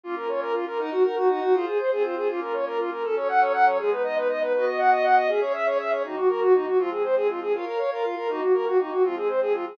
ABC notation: X:1
M:6/8
L:1/8
Q:3/8=160
K:Ebdor
V:1 name="Violin"
F B d B F B | E G B G E G | F A c A F A | F B d B F B |
[K:F#dor] A c f c f c | G B d B d B | B d f d f d | G c e c e c |
[K:Ebdor] E G B G E G | F A c A F A | F B d B F B | E G B G E G |
F A c A F A |]
V:2 name="Pad 5 (bowed)"
[B,DF]6 | [EBg]3 [EGg]3 | [FAc]3 [CFc]3 | [B,DF]6 |
[K:F#dor] [F,CA]6 | [G,B,D]6 | [B,Fd]6 | [CGe]6 |
[K:Ebdor] [E,B,G]6 | [F,A,C]6 | [Bdf]3 [FBf]3 | [E,B,G]6 |
[F,A,C]6 |]